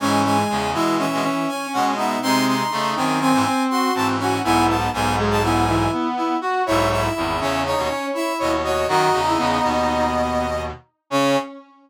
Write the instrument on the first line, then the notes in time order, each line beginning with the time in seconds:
brass section
0.00 G#2 E3 G#3 C#4 G#5
0.24 G#3 G#5
0.49 E2 C#3 G#3
0.73 B2 E3 G#3 E4 E5
0.99 E3 C#4 E5
1.12 B2 G#3
1.23 E3 C#4
1.48 C#4 G#5
1.73 B2 G#3 C#4 F#5
1.97 B3 D#4 E5
2.22 C3 G#3 C4 D#4 C6
2.46 D#4 C6
2.71 C#3 A3 D#4
2.96 F#2 D#3 C4 D#4 G#5
3.20 C4 G#5
3.33 G#2 E3
3.45 C4
3.70 F#4 C6
3.95 G#2 E3 C4 A5
4.19 C#4 F#4 G#5
4.44 B1 G#2 B3 E4 G#5
4.67 B3 A5
4.93 B1 G#2 B3 G#5
5.18 G#3 G#4
5.31 A5
5.43 B3 E4 G#5
5.67 E3 E4
5.92 B3
6.17 E4
6.41 F#4
6.66 B1 G#2 E4 C#5 E5
6.90 E4 E5
7.14 G#1 E2 E4
7.40 E2 C#3 C#4 C#5 E5
7.65 D#4 C#5
7.77 D#2 B2
7.88 C#4 C#5
8.13 E4 E5
8.39 D#2 B2 C#5 D#5
8.64 F#4 C#5 D#5
8.88 F#2 D#3 D#4 F#4 D#5
9.13 E2 C#3
9.27 E4
9.38 E2 C#3 B3
9.63 D#2 B2
11.10 C#3 C#4 C#5